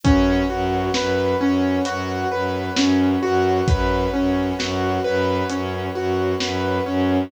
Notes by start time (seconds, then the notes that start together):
0.04 F#2 C#4 B4 C#5 F#5, kick, closed hi-hat
0.50 F#2 F#4
0.94 F#2 B4, snare
1.41 F#2 C#4
1.85 F#2 F#4, closed hi-hat
2.31 F#2 B4
2.77 F#2 C#4, snare
3.23 F#2 F#4
3.68 F#2 B4, kick, closed hi-hat
4.13 F#2 C#4
4.59 F#2 F#4, snare
5.04 F#2 B4
5.50 F#2 C#4, closed hi-hat
5.95 F#2 F#4
6.40 F#2 B4, snare
6.86 F#2 C#4